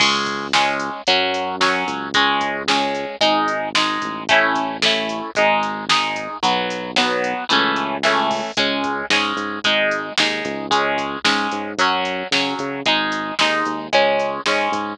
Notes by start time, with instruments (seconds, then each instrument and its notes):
0.00 synth bass 1 C#2, acoustic guitar (steel) G#3 C#4, kick, crash
0.26 kick, closed hi-hat
0.53 acoustic guitar (steel) G#3 C#4, snare
0.80 closed hi-hat
1.07 synth bass 1 F#2, acoustic guitar (steel) F#3 C#4, kick, closed hi-hat
1.34 closed hi-hat
1.61 acoustic guitar (steel) F#3 C#4, snare
1.87 synth bass 1 C#2, kick, closed hi-hat
2.14 acoustic guitar (steel) G#3 C#4, kick, closed hi-hat
2.41 kick, closed hi-hat
2.68 acoustic guitar (steel) G#3 C#4, snare
2.95 closed hi-hat
3.21 synth bass 1 G#1, acoustic guitar (steel) G#3 D#4, kick, closed hi-hat
3.48 closed hi-hat
3.75 acoustic guitar (steel) G#3 D#4, snare
4.02 synth bass 1 A1, kick, closed hi-hat
4.29 acoustic guitar (steel) A3 C#4 E4, kick, closed hi-hat
4.55 kick, closed hi-hat
4.82 acoustic guitar (steel) A3 C#4 E4, snare
5.09 closed hi-hat
5.35 synth bass 1 G#1, acoustic guitar (steel) G#3 D#4, kick, closed hi-hat
5.63 closed hi-hat
5.89 acoustic guitar (steel) G#3 D#4, snare
6.16 kick, closed hi-hat
6.43 synth bass 1 B1, acoustic guitar (steel) F#3 B3, kick, closed hi-hat
6.70 closed hi-hat
6.96 acoustic guitar (steel) F#3 B3, snare
7.24 closed hi-hat
7.49 synth bass 1 C#2, acoustic guitar (steel) E3 A3 C#4, kick, closed hi-hat
7.76 closed hi-hat
8.03 acoustic guitar (steel) E3 A3 C#4, snare
8.31 kick, open hi-hat
8.57 synth bass 1 C#2, acoustic guitar (steel) G#3 C#4, kick, closed hi-hat
8.84 kick, closed hi-hat
9.10 synth bass 1 G#2, acoustic guitar (steel) G#3 C#4, snare
9.36 synth bass 1 G#2, closed hi-hat
9.64 synth bass 1 G#1, acoustic guitar (steel) G#3 D#4, kick, closed hi-hat
9.91 closed hi-hat
10.18 synth bass 1 D#2, acoustic guitar (steel) G#3 D#4, snare
10.45 synth bass 1 C#2, kick, closed hi-hat
10.71 acoustic guitar (steel) G#3 C#4, kick, closed hi-hat
10.98 kick, closed hi-hat
11.24 synth bass 1 G#2, acoustic guitar (steel) G#3 C#4, snare
11.51 synth bass 1 G#2, closed hi-hat
11.77 synth bass 1 F#2, acoustic guitar (steel) F#3 C#4, kick, closed hi-hat
12.05 closed hi-hat
12.31 synth bass 1 C#3, acoustic guitar (steel) F#3 C#4, snare
12.59 synth bass 1 C#3, kick, closed hi-hat
12.86 synth bass 1 G#1, acoustic guitar (steel) G#3 D#4, kick, closed hi-hat
13.12 closed hi-hat
13.39 synth bass 1 D#2, acoustic guitar (steel) G#3 D#4, snare
13.66 synth bass 1 D#2, closed hi-hat
13.93 synth bass 1 C#2, acoustic guitar (steel) G#3 C#4, kick, closed hi-hat
14.20 closed hi-hat
14.46 synth bass 1 G#2, acoustic guitar (steel) G#3 C#4, snare
14.72 synth bass 1 G#2, kick, closed hi-hat